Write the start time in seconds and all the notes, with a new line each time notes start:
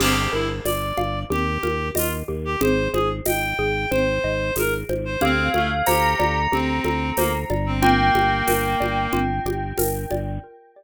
0.00 G1 G4, crash, low conga
0.32 G1 E4 A#4
0.65 G1 D5, tambourine, high conga
0.97 G1 F5, high conga
1.30 D#2 G4, low conga
1.63 D#2 A#4, high conga
1.95 D#2 F4 D#5, tambourine, high conga
2.28 D#2 G4
2.45 G4
2.61 G#1 G#4 C5, low conga
2.93 G#1 G#4 C5, high conga
3.25 G#1 D#5 G5, tambourine, high conga
3.59 G#1 G#4
3.91 G#1 C5, low conga
4.24 G#1 D#5
4.56 G#1 G#4 A#4, tambourine, high conga
4.89 G#1 C5, high conga
5.05 C5
5.21 D2 C4 G4 F5, low conga
5.54 D2 A3 A4, high conga
5.86 D2 G4 C5 A#5, tambourine, high conga
6.19 D2 D5, high conga
6.52 D2 C4 G4, low conga
6.84 D2 A4, high conga
7.17 D2 A#3 C5, tambourine, high conga
7.50 G1 D5, high conga
7.66 C4
7.81 A#3 F4 G5, low conga
8.15 G1 G4, high conga
8.48 G1 A#4, tambourine, high conga
8.80 G1 D5, high conga
9.13 G1 F4, low conga
9.45 G1 G4, high conga
9.78 G1 A#4, tambourine, high conga
10.11 G1 D5, high conga